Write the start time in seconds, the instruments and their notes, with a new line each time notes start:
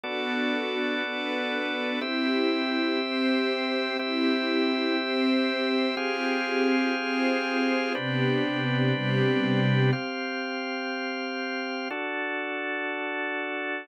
0.03 drawbar organ B3 F#4 A4 D5, string ensemble 1 B3 D4 F#4 A4
1.03 string ensemble 1 B3 D4 A4 B4
2.01 string ensemble 1 C4 E4 G4, drawbar organ C4 G4 E5
2.99 string ensemble 1 C4 G4 C5
3.99 string ensemble 1 C4 E4 G4, drawbar organ C4 G4 E5
4.98 string ensemble 1 C4 G4 C5
5.97 string ensemble 1 C4 F4 G4 G#4, drawbar organ C4 G4 G#4 F5
6.97 string ensemble 1 C4 F4 G#4 C5
7.95 string ensemble 1 C3 B3 D4 G4, drawbar organ C4 D4 G4 B4
8.93 string ensemble 1 C3 G3 B3 G4
9.93 drawbar organ C4 G4 F5
11.91 drawbar organ D4 F#4 A4